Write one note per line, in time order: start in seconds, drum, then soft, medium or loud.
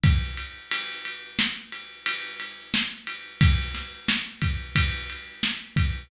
0.03 kick loud
0.03 ride medium
0.37 ride medium
0.71 ride loud
1.05 ride medium
1.39 snare loud
1.72 ride medium
2.06 ride loud
2.40 ride medium
2.74 snare loud
3.07 ride medium
3.41 kick loud
3.41 ride loud
3.74 snare medium
3.74 ride medium
4.08 snare loud
4.42 kick medium
4.42 ride medium
4.75 kick medium
4.75 ride loud
5.10 ride medium
5.43 snare loud
5.76 kick medium
5.76 ride medium